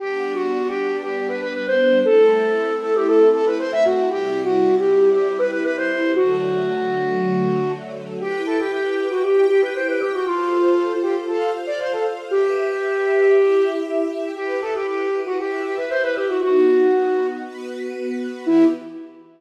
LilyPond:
<<
  \new Staff \with { instrumentName = "Flute" } { \time 4/4 \key g \major \tempo 4 = 117 \tuplet 3/2 { g'4 fis'4 g'4 } g'8 b'16 b'16 b'16 c''8. | a'4. a'16 g'16 a'8 a'16 b'16 c''16 e''16 fis'8 | \tuplet 3/2 { g'4 fis'4 g'4 } g'8 b'16 b'16 b'16 c''8. | fis'2.~ fis'8 r8 |
\key e \minor g'8 a'16 g'16 g'8. fis'16 g'8 g'16 b'16 c''16 b'16 g'16 fis'16 | f'4. g'16 r16 a'8 r16 d''16 c''16 a'16 r8 | g'2. r4 | g'8 a'16 g'16 g'8. fis'16 g'8 g'16 b'16 c''16 b'16 g'16 fis'16 |
fis'2 r2 | e'4 r2. | }
  \new Staff \with { instrumentName = "String Ensemble 1" } { \time 4/4 \key g \major <g b d'>1 | <a c' e'>1 | <c g e'>1 | <d fis a>1 |
\key e \minor <e' b' g''>2 <e' g' g''>2 | <f' a' c''>2 <f' c'' f''>2 | <g' b' e''>2 <e' g' e''>2 | <e' g' b'>2 <e' b' e''>2 |
<b dis' fis'>2 <b fis' b'>2 | <e b g'>4 r2. | }
>>